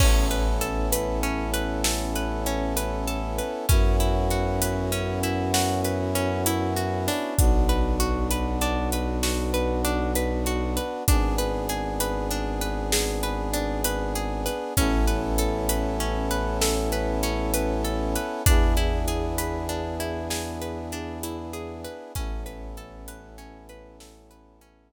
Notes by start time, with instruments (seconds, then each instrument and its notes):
0.00 violin A1, brass section B3 C#4 E4 A4, pizzicato strings C#4, kick, crash
0.31 pizzicato strings B4, closed hi-hat
0.61 pizzicato strings A4, closed hi-hat
0.92 pizzicato strings B4, closed hi-hat
1.23 pizzicato strings C#4, closed hi-hat
1.54 pizzicato strings B4, closed hi-hat
1.84 pizzicato strings A4, snare
2.16 pizzicato strings B4, closed hi-hat
2.46 pizzicato strings C#4, closed hi-hat
2.77 pizzicato strings B4, closed hi-hat
3.07 pizzicato strings A4, closed hi-hat
3.38 pizzicato strings B4, closed hi-hat
3.68 violin F#2, brass section B3 C#4 E4 F#4, pizzicato strings C#4, kick, closed hi-hat
4.00 pizzicato strings E4, closed hi-hat
4.31 pizzicato strings F#4, closed hi-hat
4.62 pizzicato strings B4, closed hi-hat
4.92 pizzicato strings C#4, closed hi-hat
5.23 pizzicato strings E4, closed hi-hat
5.54 pizzicato strings F#4, snare
5.84 pizzicato strings B4, closed hi-hat
6.15 pizzicato strings C#4, closed hi-hat
6.46 pizzicato strings E4, closed hi-hat
6.76 pizzicato strings F#4, closed hi-hat
7.08 pizzicato strings D4, open hi-hat
7.38 violin B1, brass section B3 D4 F#4, kick, closed hi-hat
7.69 pizzicato strings B4, closed hi-hat
8.00 pizzicato strings F#4, closed hi-hat
8.31 pizzicato strings B4, closed hi-hat
8.61 pizzicato strings D4, closed hi-hat
8.92 pizzicato strings B4, closed hi-hat
9.23 pizzicato strings F#4, snare
9.54 pizzicato strings B4, closed hi-hat
9.85 pizzicato strings D4, closed hi-hat
10.15 pizzicato strings B4, closed hi-hat
10.46 pizzicato strings F#4, closed hi-hat
10.77 pizzicato strings B4, closed hi-hat
11.08 violin G#1, brass section B3 D4 G#4, pizzicato strings D4, kick, closed hi-hat
11.38 pizzicato strings B4, closed hi-hat
11.69 pizzicato strings G#4, closed hi-hat
12.00 pizzicato strings B4, closed hi-hat
12.31 pizzicato strings D4, closed hi-hat
12.61 pizzicato strings B4, closed hi-hat
12.92 pizzicato strings G#4, snare
13.23 pizzicato strings B4, closed hi-hat
13.53 pizzicato strings D4, closed hi-hat
13.84 pizzicato strings B4, closed hi-hat
14.15 pizzicato strings G#4, closed hi-hat
14.46 pizzicato strings B4, closed hi-hat
14.77 violin A1, brass section B3 C#4 E4 A4, pizzicato strings C#4, kick, closed hi-hat
15.07 pizzicato strings B4, closed hi-hat
15.38 pizzicato strings A4, closed hi-hat
15.69 pizzicato strings B4, closed hi-hat
16.00 pizzicato strings C#4, closed hi-hat
16.31 pizzicato strings B4, closed hi-hat
16.61 pizzicato strings A4, snare
16.92 pizzicato strings B4, closed hi-hat
17.23 pizzicato strings C#4, closed hi-hat
17.54 pizzicato strings B4, closed hi-hat
17.84 pizzicato strings A4, closed hi-hat
18.16 pizzicato strings B4, closed hi-hat
18.46 violin E2, brass section B3 D4 E4 G#4, pizzicato strings D4, kick, closed hi-hat
18.77 pizzicato strings E4, closed hi-hat
19.08 pizzicato strings G#4, closed hi-hat
19.38 pizzicato strings B4, closed hi-hat
19.69 pizzicato strings D4, closed hi-hat
20.00 pizzicato strings E4, closed hi-hat
20.30 pizzicato strings G#4, snare
20.62 pizzicato strings B4, closed hi-hat
20.92 pizzicato strings D4, closed hi-hat
21.23 pizzicato strings E4, closed hi-hat
21.53 pizzicato strings G#4, closed hi-hat
21.84 pizzicato strings B4, closed hi-hat
22.15 violin A1, brass section B3 C#4 E4 A4, pizzicato strings C#4, kick, closed hi-hat
22.46 pizzicato strings B4, closed hi-hat
22.77 pizzicato strings A4, closed hi-hat
23.08 pizzicato strings B4, closed hi-hat
23.38 pizzicato strings C#4, closed hi-hat
23.69 pizzicato strings B4, closed hi-hat
24.00 pizzicato strings A4, snare
24.31 pizzicato strings B4, closed hi-hat
24.61 pizzicato strings C#4, closed hi-hat